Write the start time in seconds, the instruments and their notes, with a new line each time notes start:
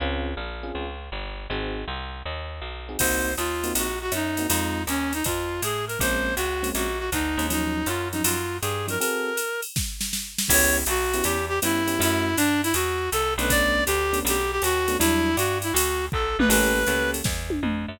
0.00 electric bass (finger) C#2, electric piano 1 C4 C#4 F4 G#4
0.37 electric bass (finger) A#1
0.63 electric piano 1 C4 C#4 F4 G#4
0.75 electric bass (finger) C#2
1.12 electric bass (finger) G1
1.50 electric bass (finger) G#1, electric piano 1 C4 D#4 F#4 G#4
1.88 electric bass (finger) C2
2.25 electric bass (finger) D#2
2.61 electric bass (finger) B1
2.89 electric piano 1 C4 D#4 F#4 G#4
2.99 electric bass (finger) C2, electric piano 1 A#3 C4 D#4 F#4, clarinet C5, kick, crash, ride
3.37 electric bass (finger) D#2, clarinet F4, hi-hat pedal, ride
3.64 electric piano 1 A#3 C4 D#4 F#4, ride
3.75 electric bass (finger) A#1, clarinet F#4, ride
4.02 clarinet F#4
4.12 electric bass (finger) F#2, clarinet D#4, hi-hat pedal, ride
4.37 electric piano 1 A#3 C4 D#4 F#4, ride
4.48 electric bass (finger) F2, electric piano 1 G#3 C4 D#4 F4, clarinet D#4, ride
4.87 electric bass (finger) D#2, clarinet C#4, hi-hat pedal, ride
5.13 clarinet D#4, ride
5.24 electric bass (finger) F2, clarinet F4, kick, ride
5.62 electric bass (finger) A2, clarinet G#4, hi-hat pedal, ride
5.87 clarinet A#4, ride
5.99 electric bass (finger) A#1, electric piano 1 G#3 A#3 C4 C#4, clarinet C5, kick, ride
6.36 electric bass (finger) C#2, clarinet F#4, hi-hat pedal, ride
6.63 electric piano 1 G#3 A#3 C4 C#4, ride
6.75 electric bass (finger) A#1, clarinet F#4, ride
6.99 clarinet F#4
7.12 electric bass (finger) D2, clarinet D#4, kick, hi-hat pedal, ride
7.37 electric bass (finger) D#2, electric piano 1 G#3 A#3 C4 C#4, ride
7.50 electric piano 1 F3 F#3 C#4 D#4, clarinet D#4, ride
7.86 electric bass (finger) F#2, clarinet F4, hi-hat pedal, ride
8.13 electric piano 1 F3 F#3 C#4 D#4, clarinet D#4, ride
8.24 electric bass (finger) F#2, clarinet F4, ride
8.62 electric bass (finger) G2, clarinet G#4, hi-hat pedal, ride
8.87 electric piano 1 F3 F#3 C#4 D#4, clarinet A#4, ride
9.00 electric piano 1 C4 F#4 G#4 A4, clarinet A#4, ride
9.37 hi-hat pedal, ride
9.62 ride
9.76 kick, snare
10.01 snare
10.13 snare
10.38 snare
10.48 electric bass (finger) C#2, electric piano 1 B3 C#4 E4 G4, clarinet C#5, kick, crash, ride
10.86 electric bass (finger) B1, clarinet F#4, hi-hat pedal, ride
11.13 electric piano 1 B3 C#4 E4 G4, ride
11.24 electric bass (finger) E2, clarinet G4, ride
11.49 clarinet G4
11.62 electric bass (finger) G2, electric piano 1 B3 C#4 E4 G4, clarinet E4, hi-hat pedal, ride
11.87 electric piano 1 B3 C#4 E4 G4, ride
11.99 electric bass (finger) F#2, electric piano 1 A3 C#4 E4 F#4, clarinet E4, ride
12.37 electric bass (finger) G2, clarinet D4, hi-hat pedal, ride
12.63 clarinet E4, ride
12.74 electric bass (finger) E2, clarinet F#4, ride
13.12 electric bass (finger) C2, clarinet A4, hi-hat pedal, ride
13.38 electric bass (finger) B1, electric piano 1 A3 B3 C#4 D4, clarinet B4, ride
13.50 clarinet D5, kick, ride
13.86 electric bass (finger) D2, clarinet G4, hi-hat pedal, ride
14.13 electric piano 1 A3 B3 C#4 D4, ride
14.25 electric bass (finger) B1, clarinet G4, ride
14.52 clarinet G4
14.62 electric bass (finger) D#2, clarinet F#4, hi-hat pedal, ride
14.88 electric piano 1 A3 B3 C#4 D4, ride
14.99 electric bass (finger) E2, electric piano 1 F#3 G3 D4 E4, clarinet E4, ride
15.37 electric bass (finger) G2, clarinet F#4, hi-hat pedal, ride
15.62 clarinet E4, ride
15.73 electric bass (finger) D2, clarinet F#4, ride
16.12 electric bass (finger) B1, clarinet A4, kick
16.39 electric bass (finger) A#1, clarinet B4, mid tom
16.49 electric bass (finger) A1, electric piano 1 A#3 C#4 G4 A4, clarinet B4, crash, ride
16.87 electric bass (finger) C#2, electric piano 1 A#3 C#4 G4 A4, hi-hat pedal, ride
17.14 ride
17.24 electric bass (finger) E2, kick, snare
17.50 high tom
17.63 electric bass (finger) F2, mid tom
17.88 electric bass (finger) F#2